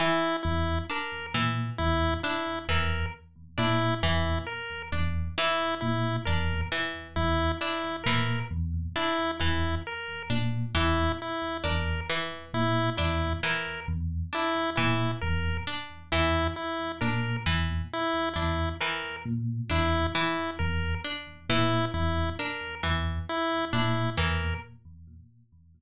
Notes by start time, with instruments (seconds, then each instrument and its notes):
0.00 harpsichord E3, lead 1 (square) E4
0.43 electric piano 1 E2, lead 1 (square) E4
0.90 harpsichord D4, lead 1 (square) A#4
1.34 electric piano 1 A#2, harpsichord E3
1.78 electric piano 1 E2, lead 1 (square) E4
2.23 harpsichord D4, lead 1 (square) E4
2.69 electric piano 1 E2, harpsichord E3, lead 1 (square) A#4
3.58 electric piano 1 A#2, harpsichord D4, lead 1 (square) E4
4.03 electric piano 1 E2, harpsichord E3, lead 1 (square) E4
4.46 lead 1 (square) A#4
4.92 electric piano 1 E2, harpsichord D4
5.38 harpsichord E3, lead 1 (square) E4
5.81 electric piano 1 A#2, lead 1 (square) E4
6.25 electric piano 1 E2, harpsichord D4, lead 1 (square) A#4
6.72 harpsichord E3
7.16 electric piano 1 E2, lead 1 (square) E4
7.61 harpsichord D4, lead 1 (square) E4
8.04 electric piano 1 A#2, harpsichord E3, lead 1 (square) A#4
8.51 electric piano 1 E2
8.96 harpsichord D4, lead 1 (square) E4
9.40 electric piano 1 E2, harpsichord E3, lead 1 (square) E4
9.87 lead 1 (square) A#4
10.30 electric piano 1 A#2, harpsichord D4
10.75 electric piano 1 E2, harpsichord E3, lead 1 (square) E4
11.22 lead 1 (square) E4
11.64 electric piano 1 E2, harpsichord D4, lead 1 (square) A#4
12.10 harpsichord E3
12.54 electric piano 1 A#2, lead 1 (square) E4
12.97 electric piano 1 E2, harpsichord D4, lead 1 (square) E4
13.43 harpsichord E3, lead 1 (square) A#4
13.88 electric piano 1 E2
14.33 harpsichord D4, lead 1 (square) E4
14.76 electric piano 1 A#2, harpsichord E3, lead 1 (square) E4
15.21 electric piano 1 E2, lead 1 (square) A#4
15.67 harpsichord D4
16.12 electric piano 1 E2, harpsichord E3, lead 1 (square) E4
16.56 lead 1 (square) E4
17.01 electric piano 1 A#2, harpsichord D4, lead 1 (square) A#4
17.46 electric piano 1 E2, harpsichord E3
17.93 lead 1 (square) E4
18.34 electric piano 1 E2, harpsichord D4, lead 1 (square) E4
18.80 harpsichord E3, lead 1 (square) A#4
19.25 electric piano 1 A#2
19.70 electric piano 1 E2, harpsichord D4, lead 1 (square) E4
20.15 harpsichord E3, lead 1 (square) E4
20.59 electric piano 1 E2, lead 1 (square) A#4
21.04 harpsichord D4
21.49 electric piano 1 A#2, harpsichord E3, lead 1 (square) E4
21.94 electric piano 1 E2, lead 1 (square) E4
22.39 harpsichord D4, lead 1 (square) A#4
22.83 electric piano 1 E2, harpsichord E3
23.29 lead 1 (square) E4
23.73 electric piano 1 A#2, harpsichord D4, lead 1 (square) E4
24.17 electric piano 1 E2, harpsichord E3, lead 1 (square) A#4